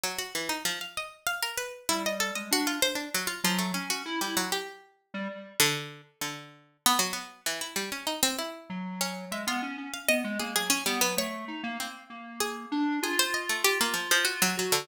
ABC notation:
X:1
M:6/8
L:1/16
Q:3/8=65
K:none
V:1 name="Harpsichord"
_G, _G E, _E F, f _e2 f _B =B2 | E _e A e _G F c D _G, F F, A, | _D _G z =G, _G, =G7 | D,3 z D,4 B, _G, B,2 |
E, E G, _D _E C =E4 D2 | e F z2 f _e2 _A A _D G, B, | _d4 C4 _A4 | _A c _e =A, G _B, F, F, _G _G, G, D, |]
V:2 name="Lead 1 (square)"
z12 | G,3 _A, D2 z4 _G,2 | _D2 E E z5 G, z2 | z12 |
z8 _G,4 | _A, B, _D D z B, A, _B, _G, z =B, G, | A,2 _E _B, z2 B,4 D2 | F10 _G2 |]